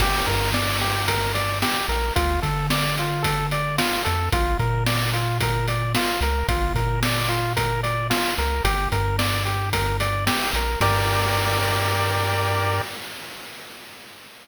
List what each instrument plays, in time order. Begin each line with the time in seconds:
0.00 synth bass 1 G1, lead 1 (square) G4, kick, crash
0.26 synth bass 1 G2, lead 1 (square) A#4, kick, closed hi-hat
0.54 lead 1 (square) D5, snare
0.81 lead 1 (square) G4, closed hi-hat
1.08 lead 1 (square) A#4, kick, closed hi-hat
1.34 lead 1 (square) D5, closed hi-hat
1.62 lead 1 (square) G4, snare
1.89 synth bass 1 A#1, lead 1 (square) A#4, closed hi-hat
2.16 synth bass 1 D2, lead 1 (square) F4, kick, closed hi-hat
2.42 synth bass 1 D3, lead 1 (square) A4, kick, closed hi-hat
2.70 lead 1 (square) D5, snare
2.97 lead 1 (square) F4, closed hi-hat
3.23 lead 1 (square) A4, kick, closed hi-hat
3.51 lead 1 (square) D5, closed hi-hat
3.78 lead 1 (square) F4, snare
4.05 synth bass 1 F2, lead 1 (square) A4, closed hi-hat
4.32 synth bass 1 A#1, lead 1 (square) F4, kick, closed hi-hat
4.59 synth bass 1 A#2, lead 1 (square) A#4, kick, closed hi-hat
4.86 lead 1 (square) D5, snare
5.13 lead 1 (square) F4, closed hi-hat
5.41 lead 1 (square) A#4, kick, closed hi-hat
5.68 lead 1 (square) D5, closed hi-hat
5.95 lead 1 (square) F4, snare
6.21 synth bass 1 C#2, lead 1 (square) A#4, closed hi-hat
6.48 synth bass 1 A#1, lead 1 (square) F4, kick, closed hi-hat
6.75 synth bass 1 A#2, lead 1 (square) A#4, kick, closed hi-hat
7.03 lead 1 (square) D5, snare
7.29 lead 1 (square) F4, closed hi-hat
7.56 lead 1 (square) A#4, kick, closed hi-hat
7.83 lead 1 (square) D5, closed hi-hat
8.10 lead 1 (square) F4, snare
8.38 synth bass 1 C#2, lead 1 (square) A#4, closed hi-hat
8.64 synth bass 1 G1, lead 1 (square) G4, kick, closed hi-hat
8.92 synth bass 1 G2, lead 1 (square) A#4, kick, closed hi-hat
9.18 lead 1 (square) D5, snare
9.45 lead 1 (square) G4, closed hi-hat
9.73 lead 1 (square) A#4, kick, closed hi-hat
10.00 lead 1 (square) D5, closed hi-hat
10.27 lead 1 (square) G4, snare
10.53 synth bass 1 A#1, lead 1 (square) A#4, closed hi-hat
10.81 synth bass 1 G2, lead 1 (square) G4 A#4 D5, kick, crash